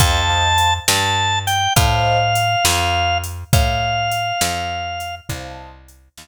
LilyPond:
<<
  \new Staff \with { instrumentName = "Drawbar Organ" } { \time 12/8 \key f \major \tempo 4. = 68 a''4. a''4 g''8 f''2. | f''2. r2. | }
  \new Staff \with { instrumentName = "Acoustic Grand Piano" } { \time 12/8 \key f \major <c'' ees'' f'' a''>8 <c'' ees'' f'' a''>2~ <c'' ees'' f'' a''>8 <c'' ees'' f'' a''>2.~ | <c'' ees'' f'' a''>2. <c'' ees'' f'' a''>2. | }
  \new Staff \with { instrumentName = "Electric Bass (finger)" } { \clef bass \time 12/8 \key f \major f,4. g,4. a,4. f,4. | a,4. f,4. c,4. ees,4. | }
  \new DrumStaff \with { instrumentName = "Drums" } \drummode { \time 12/8 <hh bd>4 hh8 sn4 hh8 <hh bd>4 hh8 sn4 hh8 | <hh bd>4 hh8 sn4 hh8 <hh bd>4 hh8 sn4. | }
>>